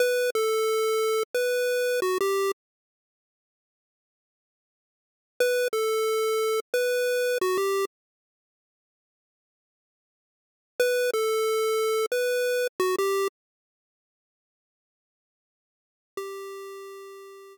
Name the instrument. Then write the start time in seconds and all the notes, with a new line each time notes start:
lead 1 (square)
0.00 B4
0.35 A4
1.35 B4
2.02 F#4
2.21 G4
5.40 B4
5.73 A4
6.74 B4
7.41 F#4
7.58 G4
10.80 B4
11.13 A4
12.12 B4
12.80 F#4
12.98 G4
16.17 G4